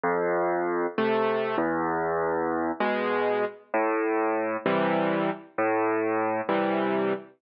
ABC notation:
X:1
M:6/8
L:1/8
Q:3/8=65
K:Am
V:1 name="Acoustic Grand Piano"
F,,3 [C,A,]2 E,,- | E,,3 [B,,^G,]3 | A,,3 [C,E,G,]3 | A,,3 [C,E,G,]3 |]